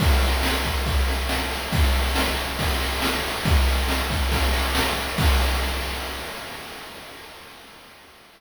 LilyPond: \new DrumStaff \drummode { \time 4/4 \tempo 4 = 139 <cymc bd>8 cymr8 sn8 <bd cymr>8 <bd cymr>8 <cymr sn>8 sn8 cymr8 | <bd cymr>8 cymr8 sn8 cymr8 <bd cymr>8 <cymr sn>8 sn8 cymr8 | <bd cymr>8 cymr8 sn8 <bd cymr>8 <bd cymr>8 <cymr sn>8 sn8 cymr8 | <cymc bd>4 r4 r4 r4 | }